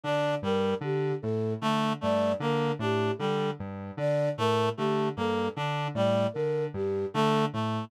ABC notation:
X:1
M:5/4
L:1/8
Q:1/4=76
K:none
V:1 name="Lead 1 (square)" clef=bass
D, G,, D, A,, D, G,, D, A,, D, G,, | D, A,, D, G,, D, A,, D, G,, D, A,, |]
V:2 name="Clarinet"
D G, z2 A, A, _B, D G, z | z A, A, _B, D G, z2 A, A, |]
V:3 name="Flute"
d _B G A z d B G A z | d _B G A z d B G A z |]